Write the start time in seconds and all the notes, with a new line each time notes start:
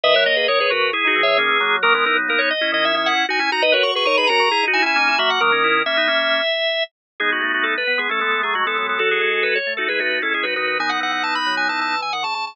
0.03 D#3 B4 D#5 E5
0.14 F#3 A#4 C#5
0.26 A#3 D#5
0.36 G#4 B4 D#5
0.48 D#3 A#4 C#5
0.60 G#4 B4 C#5
0.70 C#3 F#4 A#4 B4
0.81 C#3
0.93 E4 G#4
1.04 D#4 F#4
1.16 E3
1.23 C#5 E5
1.27 E3
1.38 D#3 A#3 C#4
1.49 E3
1.60 F#3 A#3
1.83 D#3 F#3 A#3 A#4
1.94 G#3 B3 A#4
2.06 E3 B3 D#4 A#4
2.16 F#3
2.28 A#3 A#4
2.39 C#5
2.50 D#5
2.61 C#4 E4
2.72 D#3 D#5
2.85 E5
2.94 C#4 E4 E5
3.06 F#5
3.29 D#4 F#4 G#5
3.39 C#4 E4 G#5
3.52 D#4 F#4 A#5
3.62 D#4 B4 D#5
3.72 F#4 A#4 B4 C#5
3.83 F#4 C#6
3.95 G#4 B4 C#6
4.05 D#4 A#4 C#5 C#6
4.17 G#4 B4 B5
4.27 C#4 F#4 A#4 A#5
4.40 C#3
4.51 E4 G#4
4.63 D#4
4.68 D#4 F#4
4.73 E4 G#5
4.82 C#4 E4 G#5
4.96 A#3 C#4 D#4
5.08 E4
5.18 F#3 A#3 F#4 E5
5.30 F#5
5.40 D#3 F#3 A#3 A#4
5.52 A#3 C#4
5.64 C#4 E4
5.86 A#3 C#4 E5
5.97 B3 D#4
6.08 A#3 C#4
7.20 G#3 B3 D#4 G#4
7.32 F#4
7.41 A3 F#4
7.54 F#4
7.63 A4
7.78 B4
7.87 B3
7.98 G#3 B3 G#4
8.09 A3 C#4 A4
8.20 G#3 A3 B3 A4
8.32 G#3 B3
8.42 F#3 A3 G#4
8.54 F#3 G#3 A3 F#4
8.65 E3 G#3 B3 A4
8.76 F#3 G#3 B3 A4
8.89 A4
8.98 F#3 F#4 A4
9.11 G#4
9.21 G#3 G#4
9.33 G#4
9.43 B4
9.55 C#5
9.67 A3
9.77 D#4 F#4 A4
9.88 G#3 E4 G#4 B4
9.99 A3 D#4 F#4 B4
10.11 D#4 F#4
10.22 G#3 C#4 E4 A4
10.33 G#3 C#4 E4 G#4
10.43 F#3 D#4 F#4 B4
10.56 D#3 D#4 F#4 B4
10.67 B4
10.79 D#3 B3 D#4 G#5
10.89 B3 D#4 F#5
11.00 E3 F#5
11.12 F#5
11.23 A5
11.35 B5
11.46 F#3
11.57 G#5
11.68 E3 A5
11.79 E3 A5
12.01 E3 G#5
12.13 D#3 F#5
12.23 C#3 A5
12.35 C#3 A5
12.47 A5